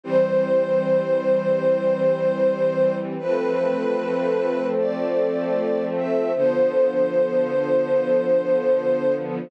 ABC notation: X:1
M:4/4
L:1/8
Q:1/4=76
K:Am
V:1 name="String Ensemble 1"
c8 | B4 d3 e | c8 |]
V:2 name="String Ensemble 1"
[E,G,C]8 | [F,A,C]8 | [D,F,B,]8 |]